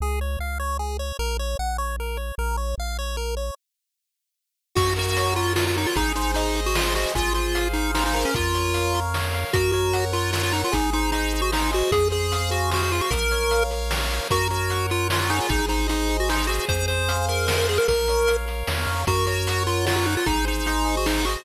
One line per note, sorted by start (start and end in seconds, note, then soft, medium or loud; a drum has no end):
0.00 0.37 C#2 medium
0.00 0.20 G#4 loud
0.21 0.39 C#5 medium
0.39 1.12 C#2 medium
0.39 0.58 F5 medium
0.60 0.77 C#5 medium
0.79 0.97 G#4 medium
0.99 1.17 C#5 medium
1.19 1.55 A#1 medium
1.19 1.37 A#4 loud
1.39 1.57 C#5 medium
1.59 2.32 A#1 medium
1.59 1.77 F#5 medium
1.78 1.96 C#5 medium
2.00 2.18 A#4 medium
2.17 2.35 C#5 medium
2.38 2.75 A#1 medium
2.38 2.57 A#4 loud
2.57 2.75 C#5 medium
2.78 3.51 A#1 medium
2.78 2.97 F5 medium
2.99 3.16 C#5 medium
3.17 3.35 A#4 medium
3.37 3.55 C#5 medium
4.75 5.86 F#2 medium
4.75 5.36 F#4 loud
4.75 4.94 F#4 medium
4.75 kick loud
4.75 crash medium
4.96 5.34 F#4 medium
4.96 5.56 A#4 medium
4.96 closed hi-hat medium
5.17 5.77 C#5 medium
5.17 closed hi-hat loud
5.36 5.53 F4 medium
5.36 5.93 F#4 medium
5.36 closed hi-hat medium
5.56 5.65 F4 medium
5.56 5.94 A#4 medium
5.56 snare loud
5.67 5.76 F4 medium
5.76 5.87 D#4 medium
5.76 5.96 C#5 medium
5.76 closed hi-hat medium
5.86 5.96 F4 medium
5.96 7.06 G#1 medium
5.96 6.13 D#4 medium
5.96 6.55 G#4 loud
5.96 kick medium
5.96 closed hi-hat loud
6.15 6.32 D#4 medium
6.15 6.75 C5 medium
6.15 closed hi-hat medium
6.34 6.61 D#4 medium
6.34 6.95 D#5 medium
6.34 closed hi-hat loud
6.55 7.12 G#4 medium
6.55 closed hi-hat medium
6.66 6.76 F#4 medium
6.75 6.94 F4 medium
6.75 7.13 C5 medium
6.75 snare loud
6.95 7.12 F#4 medium
6.95 7.14 D#5 medium
6.95 closed hi-hat medium
7.15 8.25 G#1 medium
7.15 7.33 F4 medium
7.15 7.73 G#4 medium
7.15 kick medium
7.15 closed hi-hat medium
7.34 7.68 F4 medium
7.34 7.94 C5 medium
7.34 closed hi-hat medium
7.55 8.30 F5 medium
7.55 closed hi-hat loud
7.73 7.91 D#4 medium
7.73 8.31 G#4 medium
7.73 closed hi-hat medium
7.94 8.04 D#4 medium
7.94 8.32 C5 medium
7.94 snare loud
8.06 8.15 D#4 medium
8.14 8.25 D#4 medium
8.14 8.94 A#4 loud
8.14 open hi-hat medium
8.25 8.34 C#4 medium
8.34 9.45 F2 medium
8.34 9.00 F4 medium
8.34 kick loud
8.34 closed hi-hat medium
8.54 9.14 C#5 medium
8.54 closed hi-hat medium
8.74 9.34 F5 medium
8.74 closed hi-hat medium
8.94 9.51 A#4 medium
8.94 closed hi-hat medium
9.14 9.52 C#5 medium
9.14 snare medium
9.34 9.53 F5 medium
9.34 closed hi-hat medium
9.53 10.64 F#2 medium
9.53 9.72 F#4 medium
9.53 10.12 A#4 medium
9.53 kick loud
9.53 closed hi-hat loud
9.72 10.05 F#4 medium
9.72 10.33 C#5 medium
9.72 closed hi-hat medium
9.93 10.53 F#5 medium
9.93 closed hi-hat loud
10.12 10.31 F4 medium
10.12 10.69 A#4 medium
10.12 closed hi-hat medium
10.33 10.42 F4 medium
10.33 10.71 C#5 medium
10.33 snare loud
10.43 10.53 F4 medium
10.52 10.62 D#4 medium
10.52 10.72 F#5 medium
10.52 closed hi-hat medium
10.64 10.74 F4 medium
10.72 11.83 G#1 medium
10.72 10.90 D#4 medium
10.72 11.33 G#4 loud
10.72 kick medium
10.72 closed hi-hat loud
10.93 11.11 D#4 medium
10.93 11.52 C5 medium
10.93 closed hi-hat medium
11.12 11.41 D#4 medium
11.12 11.72 D#5 medium
11.12 closed hi-hat medium
11.33 11.90 G#4 medium
11.33 closed hi-hat medium
11.42 11.51 F#4 medium
11.52 11.71 D#4 medium
11.52 11.90 C5 medium
11.52 snare loud
11.72 11.91 F#4 medium
11.72 11.91 D#5 medium
11.72 closed hi-hat medium
11.92 13.01 F2 medium
11.92 12.08 G#4 medium
11.92 12.49 G#4 loud
11.92 kick loud
11.92 closed hi-hat loud
12.10 12.50 G#4 medium
12.10 12.71 C5 medium
12.10 closed hi-hat medium
12.32 12.93 F5 medium
12.32 closed hi-hat medium
12.50 12.70 F#4 medium
12.50 13.07 G#4 medium
12.50 closed hi-hat medium
12.71 12.82 F#4 medium
12.71 13.09 C5 medium
12.71 snare loud
12.83 12.92 F#4 medium
12.92 13.01 F4 medium
12.92 13.12 F5 medium
12.92 closed hi-hat medium
13.01 13.11 F#4 medium
13.10 14.20 A#1 medium
13.10 13.71 A#4 loud
13.10 13.63 A#4 medium
13.10 kick loud
13.10 closed hi-hat loud
13.31 13.90 C#5 medium
13.31 closed hi-hat medium
13.51 14.09 F5 medium
13.51 closed hi-hat medium
13.71 14.28 A#4 medium
13.71 closed hi-hat medium
13.90 14.28 C#5 medium
13.90 snare loud
14.10 14.28 F5 medium
14.10 closed hi-hat medium
14.30 15.41 F#2 medium
14.30 14.48 F#4 medium
14.30 14.91 A#4 loud
14.30 kick medium
14.30 closed hi-hat medium
14.50 14.87 F#4 medium
14.50 15.09 C#5 medium
14.50 closed hi-hat medium
14.70 15.46 F#5 medium
14.70 closed hi-hat medium
14.90 15.08 F4 medium
14.90 15.48 A#4 medium
14.90 closed hi-hat medium
15.10 15.20 F4 medium
15.10 15.48 C#5 medium
15.10 snare loud
15.21 15.30 F4 medium
15.30 15.39 D#4 medium
15.30 16.09 G#4 loud
15.30 closed hi-hat medium
15.40 15.50 F4 medium
15.49 16.60 G#1 medium
15.49 15.66 D#4 medium
15.49 kick loud
15.49 closed hi-hat medium
15.68 15.87 D#4 medium
15.68 16.29 C5 medium
15.68 closed hi-hat medium
15.88 16.17 D#4 medium
15.88 16.63 D#5 medium
15.88 closed hi-hat medium
16.09 16.48 G#4 medium
16.09 closed hi-hat medium
16.20 16.29 F#4 medium
16.29 16.47 D#4 medium
16.29 16.67 C5 medium
16.29 snare medium
16.47 16.65 F#4 medium
16.47 17.28 G#4 loud
16.47 closed hi-hat medium
16.68 17.79 F2 medium
16.68 16.86 C5 medium
16.68 kick medium
16.68 closed hi-hat medium
16.88 17.26 C5 medium
16.88 17.46 C5 medium
16.88 closed hi-hat medium
17.09 17.68 F5 medium
17.09 closed hi-hat loud
17.28 17.85 G#4 medium
17.28 17.47 A#4 medium
17.28 closed hi-hat medium
17.47 17.57 A#4 medium
17.47 17.84 C5 medium
17.47 snare loud
17.58 17.67 A#4 medium
17.68 17.78 G#4 medium
17.68 17.87 F5 medium
17.68 open hi-hat medium
17.78 17.87 A#4 medium
17.88 18.64 A#1 medium
17.88 18.46 A#4 loud
17.88 18.37 A#4 medium
17.88 kick medium
17.88 closed hi-hat medium
18.08 18.68 C#5 medium
18.08 closed hi-hat medium
18.27 18.86 F5 medium
18.27 closed hi-hat medium
18.46 19.03 A#4 medium
18.46 closed hi-hat medium
18.67 18.86 E2 medium
18.67 19.06 C#5 medium
18.67 snare loud
18.86 19.05 F2 medium
18.86 19.05 F5 medium
18.86 closed hi-hat medium
19.07 20.17 F#2 medium
19.07 19.26 F#4 medium
19.07 19.66 A#4 loud
19.07 kick loud
19.07 closed hi-hat medium
19.26 19.63 F#4 medium
19.26 19.85 C#5 medium
19.26 closed hi-hat medium
19.47 20.06 F#5 medium
19.47 closed hi-hat loud
19.66 19.86 F4 medium
19.66 20.23 A#4 medium
19.66 closed hi-hat medium
19.86 19.96 F4 medium
19.86 20.24 C#5 medium
19.86 snare loud
19.96 20.06 F4 medium
20.06 20.15 D#4 medium
20.06 20.25 F#5 medium
20.06 closed hi-hat medium
20.17 20.26 F4 medium
20.26 21.37 G#1 medium
20.26 20.45 D#4 medium
20.26 20.84 G#4 medium
20.26 kick loud
20.26 closed hi-hat medium
20.45 20.66 D#4 medium
20.45 21.06 C5 medium
20.45 closed hi-hat medium
20.66 20.96 D#4 medium
20.66 21.26 D#5 medium
20.66 closed hi-hat medium
20.85 21.41 G#4 medium
20.85 closed hi-hat medium
20.97 21.07 F#4 medium
21.06 21.25 D#4 medium
21.06 21.45 C5 medium
21.06 snare loud
21.25 21.43 F#4 medium
21.25 21.45 D#5 medium
21.25 closed hi-hat medium